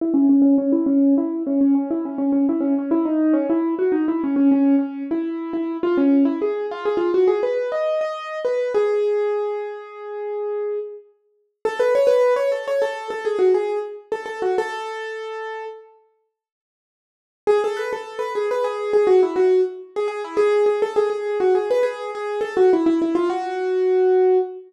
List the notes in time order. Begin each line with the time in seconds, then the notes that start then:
0.01 E4
0.14 C#4
0.29 C#4
0.42 C#4
0.58 C#4
0.72 E4
0.86 C#4
1.18 E4
1.47 C#4
1.61 C#4
1.75 C#4
1.91 E4
2.05 C#4
2.18 C#4
2.32 C#4
2.49 E4
2.61 C#4
2.79 C#4
2.91 E4
3.05 D#4
3.33 C#4
3.50 E4
3.79 F#4
3.92 D#4
4.08 E4
4.24 C#4
4.36 C#4
4.51 C#4
4.79 C#4
5.11 E4
5.53 E4
5.83 F4
5.97 C#4
6.25 E4
6.42 G#4
6.71 F4
6.85 G#4
6.97 F4
7.14 F#4
7.28 G#4
7.43 B4
7.72 D#5
8.01 D#5
8.45 B4
8.75 G#4
11.65 A4
11.79 B4
11.95 C#5
12.07 B4
12.36 C#5
12.52 A4
12.68 C#5
12.82 A4
13.10 A4
13.25 G#4
13.39 F#4
13.54 G#4
14.12 A4
14.26 A4
14.42 F#4
14.58 A4
17.47 G#4
17.64 A4
17.77 B4
17.93 A4
18.19 B4
18.35 G#4
18.51 B4
18.64 G#4
18.93 G#4
19.07 F#4
19.23 E4
19.36 F#4
19.96 G#4
20.08 G#4
20.24 E4
20.37 G#4
20.66 G#4
20.82 A4
20.96 G#4
21.10 G#4
21.40 F#4
21.55 G#4
21.71 B4
21.83 G#4
22.15 G#4
22.41 A4
22.57 F#4
22.73 E4
22.86 E4
23.02 E4
23.15 F4
23.30 F#4